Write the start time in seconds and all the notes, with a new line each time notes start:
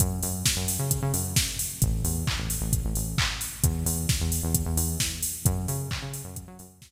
0.00 F#2, kick, closed hi-hat
0.23 F#2, open hi-hat
0.46 kick, snare
0.57 F#2
0.68 open hi-hat
0.79 C#3
0.91 kick, closed hi-hat
1.02 C#3
1.14 F#2, open hi-hat
1.36 kick, snare
1.59 open hi-hat
1.82 A1, kick, closed hi-hat
2.04 E2, open hi-hat
2.27 kick, clap
2.38 A1
2.50 open hi-hat
2.61 A1
2.73 kick, closed hi-hat
2.85 A1
2.95 A1, open hi-hat
3.18 kick, clap
3.41 open hi-hat
3.64 E2, kick, closed hi-hat
3.86 E2, open hi-hat
4.09 kick, snare
4.21 E2
4.32 open hi-hat
4.43 E2
4.55 kick, closed hi-hat
4.66 E2
4.77 E2, open hi-hat
5.00 kick, snare
5.23 open hi-hat
5.45 F#2, kick, closed hi-hat
5.68 C#3, open hi-hat
5.91 kick, clap
6.02 C#3
6.14 open hi-hat
6.24 F#2
6.36 kick, closed hi-hat
6.48 F#3
6.59 F#2, open hi-hat
6.82 kick, snare